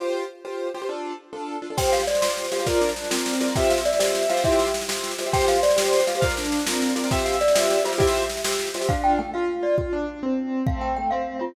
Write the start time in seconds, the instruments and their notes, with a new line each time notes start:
0.00 acoustic grand piano F4 G4 C5
0.45 acoustic grand piano F4 G4 C5
0.74 acoustic grand piano F4 G4 C5
0.82 acoustic grand piano F4 G4 C5
0.89 acoustic grand piano D4 F4 A4
1.33 acoustic grand piano D4 F4 A4
1.62 acoustic grand piano D4 F4 A4
1.70 acoustic grand piano D4 F4 A4
1.77 acoustic grand piano F4 G4 C5, glockenspiel G5, kick, snare, crash
1.85 snare
1.92 acoustic grand piano C5, glockenspiel F5, snare
2.00 snare
2.07 glockenspiel D5, snare
2.15 snare
2.22 acoustic grand piano F4 G4 C5, snare
2.30 snare
2.37 snare
2.44 snare
2.52 acoustic grand piano F4 G4 C5, glockenspiel F5, snare
2.59 acoustic grand piano F4 G4 C5, snare
2.65 acoustic grand piano F4 A#4 D5, kick, snare
2.74 snare
2.81 acoustic grand piano D4, snare
2.89 snare
2.96 snare
3.04 snare
3.10 acoustic grand piano C4 F4 A#4 D5, snare
3.18 snare
3.26 snare
3.33 snare
3.41 acoustic grand piano F4 A#4 D5, snare
3.47 acoustic grand piano F4 A#4 D5, snare
3.55 acoustic grand piano F4 G4 C5 E5, glockenspiel G5, kick, snare
3.63 snare
3.70 acoustic grand piano E5, glockenspiel F5, snare
3.78 snare
3.85 glockenspiel D5, snare
3.93 snare
3.99 acoustic grand piano F4 G4 C5 E5, snare
4.07 snare
4.15 snare
4.22 snare
4.30 acoustic grand piano F4 G4 C5 E5, glockenspiel F5, snare
4.37 snare
4.44 acoustic grand piano E4 G4, glockenspiel E5, kick, snare
4.52 snare
4.59 snare
4.67 snare
4.74 snare
4.81 snare
4.89 acoustic grand piano F4 G4 C5 E5, snare
4.96 snare
5.04 snare
5.11 snare
5.18 acoustic grand piano F4 G4 C5 E5, snare
5.26 acoustic grand piano F4 G4 C5 E5, snare
5.32 acoustic grand piano F4 G4 C5, glockenspiel G5, kick, snare
5.41 snare
5.48 acoustic grand piano C5, glockenspiel F5, snare
5.56 snare
5.63 glockenspiel D5, snare
5.70 snare
5.76 acoustic grand piano F4 G4 C5, snare
5.85 snare
5.93 snare
6.00 snare
6.07 acoustic grand piano F4 G4 C5, glockenspiel F5, snare
6.15 acoustic grand piano F4 G4 C5, snare
6.21 acoustic grand piano F4 A#4 D5 F5, kick, snare
6.30 snare
6.37 acoustic grand piano D4, snare
6.44 snare
6.52 snare
6.59 snare
6.66 acoustic grand piano C4 F4 A#4 D5, snare
6.74 snare
6.82 snare
6.89 snare
6.96 acoustic grand piano F4 A#4 D5, snare
7.04 acoustic grand piano F4 A#4 D5, snare
7.11 acoustic grand piano F4 G4 C5 E5, glockenspiel G5, kick, snare
7.19 snare
7.25 acoustic grand piano E5, glockenspiel F5, snare
7.33 snare
7.41 glockenspiel D5, snare
7.48 snare
7.55 acoustic grand piano F4 G4 C5 E5, snare
7.63 snare
7.70 snare
7.78 snare
7.84 acoustic grand piano F4 G4 C5 E5, glockenspiel F4, snare
7.92 acoustic grand piano F4 G4 C5 E5, snare
7.98 acoustic grand piano E4 F4 G4 C5 E5, glockenspiel E5, kick, snare
8.07 snare
8.15 snare
8.22 snare
8.30 snare
8.37 snare
8.44 acoustic grand piano F4 G4 C5 E5, snare
8.52 snare
8.59 snare
8.67 snare
8.74 acoustic grand piano F4 G4 C5 E5, snare
8.81 acoustic grand piano F4 G4 C5 E5, snare
8.89 acoustic grand piano D4 F4, glockenspiel F5, kick
9.04 glockenspiel G5
9.19 acoustic grand piano A3, glockenspiel G5
9.34 acoustic grand piano F4, glockenspiel F5
9.63 acoustic grand piano F4, glockenspiel D5
9.78 acoustic grand piano F4, kick
9.93 acoustic grand piano D4
10.23 acoustic grand piano C4
10.67 acoustic grand piano A3 C4, glockenspiel F5, kick
10.81 glockenspiel G5
10.96 acoustic grand piano A3, glockenspiel G5
11.11 acoustic grand piano C4, glockenspiel F5
11.39 acoustic grand piano C4, glockenspiel F4